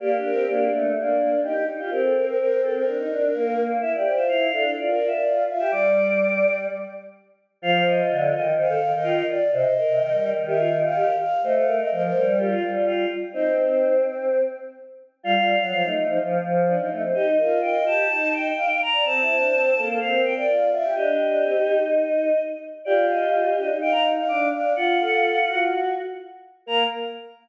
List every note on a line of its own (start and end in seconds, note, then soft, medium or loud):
0.00 0.15 A#3 medium
0.00 0.66 G4 loud
0.00 0.11 D5 medium
0.16 0.31 D4 medium
0.24 0.46 A#4 medium
0.32 0.47 C4 medium
0.48 0.68 A#3 medium
0.48 0.90 D4 medium
0.71 0.94 A3 medium
0.95 1.17 A#3 medium
0.95 1.40 D4 medium
1.19 1.30 A#3 medium
1.43 1.54 D#4 loud
1.43 1.63 G4 medium
1.55 1.66 D#4 medium
1.67 1.78 D#4 medium
1.78 1.90 F4 medium
1.78 1.90 G4 medium
1.90 2.84 C4 medium
1.90 2.02 G4 medium
1.90 2.50 A#4 loud
2.02 2.14 A4 medium
2.14 2.25 A#4 medium
2.26 2.37 A#4 medium
2.39 2.61 A#4 medium
2.62 2.73 A4 medium
2.74 3.63 A#4 medium
2.86 2.97 D4 medium
2.98 3.09 D#4 medium
3.09 3.30 D4 medium
3.33 3.55 A#3 medium
3.57 3.77 A#3 medium
3.81 3.96 E4 medium
3.81 3.92 E5 loud
3.94 4.12 G4 medium
3.94 4.17 D5 medium
4.05 4.44 C5 medium
4.13 4.28 F4 medium
4.13 4.27 E5 medium
4.28 4.51 E4 medium
4.28 4.71 F5 medium
4.52 4.73 D4 medium
4.52 4.64 A4 medium
4.64 4.76 A4 medium
4.76 4.97 F4 medium
4.76 4.91 D5 medium
4.88 5.11 A#4 medium
4.93 5.08 D5 medium
5.00 5.11 F4 medium
5.07 5.22 E5 loud
5.12 5.44 D5 medium
5.24 5.45 F4 medium
5.48 5.59 F4 medium
5.48 5.71 E5 medium
5.59 5.71 G4 medium
5.59 5.70 E5 medium
5.71 6.67 G3 medium
5.71 6.59 D5 medium
5.71 6.53 D6 loud
7.62 8.01 F3 loud
7.62 8.43 F4 loud
7.62 7.84 F5 loud
7.87 8.33 D#5 loud
8.10 8.31 D3 medium
8.33 8.73 D#3 medium
8.33 8.53 D#5 loud
8.57 8.69 C5 loud
8.57 8.92 F5 medium
8.69 8.80 A4 loud
8.81 8.92 D#3 medium
8.93 9.22 D#3 loud
8.93 9.24 D#5 medium
9.03 9.25 F4 loud
9.29 9.51 D5 loud
9.52 9.64 C3 loud
9.52 9.74 C5 loud
9.52 10.29 D#5 loud
9.78 10.18 A#4 loud
9.88 9.99 C3 medium
10.00 10.11 D#3 loud
10.12 10.33 G3 medium
10.24 10.45 A#4 medium
10.36 11.07 D#3 medium
10.47 10.58 G4 loud
10.47 10.77 E5 loud
10.58 10.70 F4 medium
10.83 11.14 F5 loud
10.96 11.16 G4 loud
11.19 11.41 F5 medium
11.43 11.81 A3 medium
11.43 11.66 C5 loud
11.43 11.54 D#5 loud
11.55 11.75 F5 loud
11.67 12.06 A#4 loud
11.78 11.90 D#5 medium
11.91 12.10 F3 medium
11.91 12.02 D#5 medium
12.02 12.25 C5 loud
12.14 12.54 G3 medium
12.14 12.35 A#4 loud
12.26 12.38 C5 medium
12.38 12.71 F4 medium
12.38 12.50 G4 loud
12.51 12.62 F4 loud
12.62 12.73 G3 medium
12.74 13.05 G3 medium
12.74 12.85 F4 medium
12.86 13.07 F4 loud
13.33 13.56 C4 loud
13.33 13.93 D#4 loud
13.33 14.01 C5 loud
13.57 14.41 C4 medium
15.23 15.35 G3 loud
15.23 15.35 F4 loud
15.23 15.89 F5 loud
15.36 15.57 G3 medium
15.36 15.56 F4 loud
15.60 15.71 F#3 medium
15.71 15.83 F3 medium
15.71 15.83 F4 loud
15.83 15.95 A3 medium
15.83 16.04 D#4 medium
15.95 16.06 A3 medium
16.07 16.18 F3 loud
16.07 16.18 D#4 medium
16.19 16.38 F3 loud
16.43 16.74 F3 loud
16.67 16.78 D4 medium
16.78 16.90 F3 medium
16.78 16.90 D#4 medium
16.90 17.02 A3 medium
16.90 17.02 D#4 medium
17.02 17.14 C4 medium
17.14 17.37 D#4 loud
17.14 17.26 G4 loud
17.14 17.59 D#5 loud
17.38 17.80 F4 medium
17.38 17.61 A#4 medium
17.62 18.02 D#5 medium
17.62 17.84 G5 loud
17.86 18.08 G4 loud
17.86 18.32 A5 loud
18.09 18.50 D#4 medium
18.09 18.48 D#5 medium
18.33 18.79 G5 loud
18.57 18.68 F5 medium
18.69 18.81 F5 medium
18.82 19.05 A#5 loud
18.93 19.04 D5 medium
19.05 19.20 C4 loud
19.05 19.88 A5 loud
19.21 19.36 E4 loud
19.28 19.70 C5 medium
19.37 19.52 D4 medium
19.52 19.73 C4 loud
19.76 19.98 A#3 medium
19.76 19.87 A4 medium
19.88 19.99 A4 medium
20.00 20.23 C4 medium
20.00 20.21 F5 loud
20.12 20.33 A#4 medium
20.24 20.35 C4 medium
20.24 20.35 G5 loud
20.35 20.70 D5 medium
20.35 20.46 G5 loud
20.48 20.68 F4 medium
20.71 20.83 F4 loud
20.71 20.93 E5 loud
20.83 20.95 G4 medium
20.95 21.17 D4 loud
20.95 21.79 G4 loud
20.95 22.42 D#5 loud
21.19 21.42 D4 medium
21.43 21.54 C4 medium
21.55 22.32 D#4 medium
22.85 23.51 F4 loud
22.85 23.66 G4 loud
22.85 23.05 D5 loud
23.11 23.56 D#5 loud
23.57 23.69 D4 loud
23.57 23.77 D#5 loud
23.69 24.21 D#4 medium
23.81 24.10 F5 loud
23.81 23.93 G5 loud
23.92 24.03 A#5 loud
24.17 24.49 F5 medium
24.28 24.52 D4 loud
24.28 24.49 D6 loud
24.53 24.74 D4 medium
24.53 24.73 F5 loud
24.76 24.98 F4 loud
24.76 25.68 F4 loud
24.76 25.61 F#5 loud
25.00 25.39 A4 medium
25.47 25.89 F#4 loud
26.66 26.83 A#3 loud
26.66 26.83 A#4 loud
26.66 26.84 A#5 loud